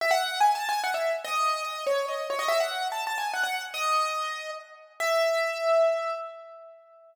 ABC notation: X:1
M:3/4
L:1/16
Q:1/4=144
K:E
V:1 name="Acoustic Grand Piano"
e f3 (3g2 a2 g2 f e2 z | d4 d2 c2 d2 c d | e f3 (3a2 a2 g2 f f2 z | d8 z4 |
e12 |]